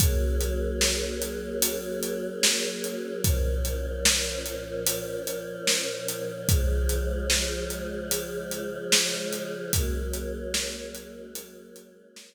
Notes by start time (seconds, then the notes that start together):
0.00 F#3 A#3 C#4 G#4, kick, closed hi-hat
0.41 closed hi-hat
0.81 snare
1.22 closed hi-hat
1.62 closed hi-hat
2.03 closed hi-hat
2.43 snare
2.84 closed hi-hat
3.24 A#2 F3 C#4, kick, closed hi-hat
3.65 closed hi-hat
4.05 snare
4.46 closed hi-hat
4.86 closed hi-hat
5.27 closed hi-hat
5.67 snare
6.08 closed hi-hat
6.49 C#3 F3 G#3, kick, closed hi-hat
6.89 closed hi-hat
7.30 snare
7.70 closed hi-hat
8.11 closed hi-hat
8.51 closed hi-hat
8.92 snare
9.33 closed hi-hat
9.73 F#3 G#3 A#3 C#4, kick, closed hi-hat
10.14 closed hi-hat
10.54 snare
10.95 closed hi-hat
11.35 closed hi-hat
11.76 closed hi-hat
12.16 snare